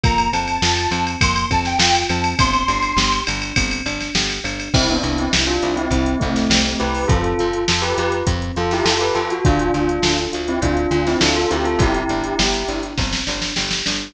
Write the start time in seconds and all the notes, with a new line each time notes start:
0.04 F2 A#3 A#5, kick, ride
0.18 ride
0.32 F2 C4 A5, ride
0.48 ride
0.62 F2 F4, snare
0.77 ride
0.91 F2 C4, ride
1.07 ride
1.21 F2 A#3 C6, kick, ride
1.36 ride
1.51 F2 C4 A5, kick, ride
1.65 G5, snare, ride
1.79 F2 F4 G5, snare
1.95 ride
2.09 F2 C4 A5, ride
2.24 ride
2.39 G1 C4 C6, kick, ride
2.53 ride
2.68 G1 D4, ride
2.82 ride
2.97 G1 G4, snare
3.12 ride
3.27 G1 D4, ride
3.42 ride
3.56 G1 C4, kick, ride
3.71 ride
3.86 G1 D4, ride
4.01 snare, ride
4.15 G1 G4, snare
4.30 ride
4.44 G1 D4, ride
4.60 ride
4.74 C2 C4 E4, kick, crash
4.89 B3 D4, closed hi-hat
5.03 C2 E4, closed hi-hat
5.18 C4 E4, closed hi-hat
5.33 C2 G4, snare
5.47 D4 F4, closed hi-hat
5.62 C2 E4, closed hi-hat
5.76 C4 E4, closed hi-hat
5.91 C2 C4, kick, closed hi-hat
6.06 closed hi-hat
6.19 C2 A3 C4 E4, kick, closed hi-hat
6.36 snare, closed hi-hat
6.50 C2 G4, snare
6.65 closed hi-hat
6.80 C2 E4 G4 B4, closed hi-hat
6.94 open hi-hat
7.08 F2 C4 F4 A4, kick, closed hi-hat
7.24 closed hi-hat
7.39 F2 F4, closed hi-hat
7.53 closed hi-hat
7.68 F2 F4 A4, snare
7.82 G4 B4, closed hi-hat
7.98 F2 F4 G4 B4, closed hi-hat
8.12 closed hi-hat
8.27 F2 C4, kick, closed hi-hat
8.42 closed hi-hat
8.56 F2 F4 A4, closed hi-hat
8.71 E4 G4, snare, closed hi-hat
8.85 F2 F4 A4, snare
9.00 G4 B4, closed hi-hat
9.15 F2 F4 A4, closed hi-hat
9.30 F#4, closed hi-hat
9.45 D2 D4 F4, kick, closed hi-hat
9.59 closed hi-hat
9.74 D2 F4, closed hi-hat
9.89 closed hi-hat
10.02 D2 A4, snare
10.18 closed hi-hat
10.33 D2 F4, closed hi-hat
10.48 C4 E4, closed hi-hat
10.62 D2 D4 F4, kick, closed hi-hat
10.77 closed hi-hat
10.91 D2 D4 F4, closed hi-hat
11.07 C4 E4, snare, closed hi-hat
11.21 D2 D4 F4 A4, snare
11.36 F4 A4, closed hi-hat
11.51 D2 C4 E4 G4, closed hi-hat
11.65 F4 A4, closed hi-hat
11.79 G1 E4 G4, kick, closed hi-hat
11.94 closed hi-hat
12.09 G1 D4, closed hi-hat
12.24 closed hi-hat
12.39 G1 G4, snare
12.54 closed hi-hat
12.68 G1 D4, closed hi-hat
12.83 closed hi-hat
12.98 G1 C4, kick, snare
13.13 snare
13.27 G1 D4, snare
13.42 snare
13.56 G1 G4, snare
13.71 snare
13.86 G1 D4, snare